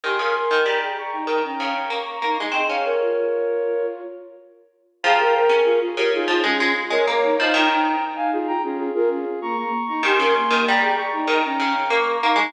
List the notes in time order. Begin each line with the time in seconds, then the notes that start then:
0.04 D#3 G4 G#5 C6
0.19 C#3 A#4
0.35 A#4
0.51 D#3
0.66 G3 G5 A#5
0.82 G#4 G5 A#5
0.98 A#5 C#6
1.11 D#4 G5 A#5
1.27 D#3 G5 A#5
1.44 C#4 G5 A#5
1.60 C#3
1.90 A#3 A#5 C#6
2.06 A#5 C#6
2.22 A#3 D#4
2.38 G#3 D#4 A#5 C#6
2.52 C4 G#4 D#5 G5
2.68 C#4 C#5 F5
2.85 A#4 C#5
3.00 F4
5.03 F3 G#4 G5 A#5
5.19 A#4
5.35 A#4
5.49 C#4
5.64 F4 G#4
5.81 F4 G#4
5.97 C#3 G4 A#4
6.13 D#4 F4 G#4
6.28 F3 F4 G#4
6.43 G#3 C#4 F4 G#4
6.60 G#3
6.90 G#3 A#4 C#5
7.07 A#3 A#4 C#5
7.23 D#4
7.38 F3 D#4 C5 D#5
7.53 D#3 D#4 G5 A#5
7.70 D#4
8.01 D#4
8.16 F5 G#5
8.32 F4 G#4
8.47 G5 A#5
8.63 C#4 F4 G#4
8.78 F4 G#4
8.94 F4 G#4 A#4
9.10 C#4
9.41 A#3 A#5 C#6
9.57 A#3 A#5 C#6
9.88 D#4 A#5 C#6
10.03 D#3 G4 G#5 C6
10.19 C#3 A#4
10.35 A#3
10.51 D#3
10.67 G3 G5 A#5
10.82 G#4 G5 A#5
10.97 A#5 C#6
11.13 D#4 G5 A#5
11.27 D#3 G5 A#5
11.45 C#4 G5 A#5
11.60 C#3
11.90 A#3 A#5 C#6
12.07 A#5 C#6
12.22 A#3 D#4
12.36 G#3 D#4 A#5 C#6